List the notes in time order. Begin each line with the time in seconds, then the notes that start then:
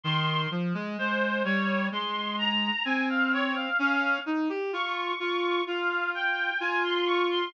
0.04 D#3 C6
0.51 F3
0.74 G#3
0.98 G#3 C5
1.45 G3 C#5
1.92 G#3 C6
2.38 A#5
2.85 C4 G#5
3.10 F5
3.33 C#5
3.55 F5
3.79 C#4 F5
4.26 D#4
4.49 G4
4.73 F4 C#6
5.20 F4 C#6
5.67 F4 F5
6.15 G5
6.60 F4 G#5
6.84 C6
7.06 C#6
7.31 C6